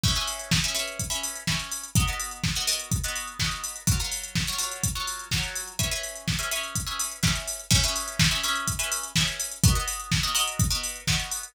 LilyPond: <<
  \new Staff \with { instrumentName = "Pizzicato Strings" } { \time 4/4 \key cis \dorian \tempo 4 = 125 <cis' gis' b' e''>16 <cis' gis' b' e''>4 <cis' gis' b' e''>16 <cis' gis' b' e''>8. <cis' gis' b' e''>8. <cis' gis' b' e''>4 | <b fis' ais' dis''>16 <b fis' ais' dis''>4 <b fis' ais' dis''>16 <b fis' ais' dis''>8. <b fis' ais' dis''>8. <b fis' ais' dis''>4 | <fis eis' ais' cis''>16 <fis eis' ais' cis''>4 <fis eis' ais' cis''>16 <fis eis' ais' cis''>8. <fis eis' ais' cis''>8. <fis eis' ais' cis''>4 | <cis' gis' b' e''>16 <cis' gis' b' e''>4 <cis' gis' b' e''>16 <cis' gis' b' e''>8. <cis' gis' b' e''>8. <cis' gis' b' e''>4 |
<cis' gis' b' e''>16 <cis' gis' b' e''>4 <cis' gis' b' e''>16 <cis' gis' b' e''>8. <cis' gis' b' e''>8. <cis' gis' b' e''>4 | <b fis' ais' dis''>16 <b fis' ais' dis''>4 <b fis' ais' dis''>16 <b fis' ais' dis''>8. <b fis' ais' dis''>8. <b fis' ais' dis''>4 | }
  \new DrumStaff \with { instrumentName = "Drums" } \drummode { \time 4/4 <cymc bd>16 hh16 hho16 hh16 <bd sn>16 hh16 hho16 hh16 <hh bd>16 hh16 hho16 hh16 <bd sn>16 hh16 hho16 hh16 | <hh bd>16 hh16 hho16 hh16 <bd sn>16 hh16 hho16 hh16 <hh bd>16 hh16 hho16 hh16 <bd sn>16 hh16 hho16 hh16 | <hh bd>16 hh16 hho16 hh16 <bd sn>16 hh16 hho16 hh16 <hh bd>16 hh16 hho16 hh16 <bd sn>16 hh16 hho16 hh16 | <hh bd>16 hh16 hho16 hh16 <bd sn>16 hh16 hho16 hh16 <hh bd>16 hh16 hho16 hh16 <bd sn>16 hh16 hho16 hh16 |
<cymc bd>16 hh16 hho16 hh16 <bd sn>16 hh16 hho16 hh16 <hh bd>16 hh16 hho16 hh16 <bd sn>16 hh16 hho16 hh16 | <hh bd>16 hh16 hho16 hh16 <bd sn>16 hh16 hho16 hh16 <hh bd>16 hh16 hho16 hh16 <bd sn>16 hh16 hho16 hh16 | }
>>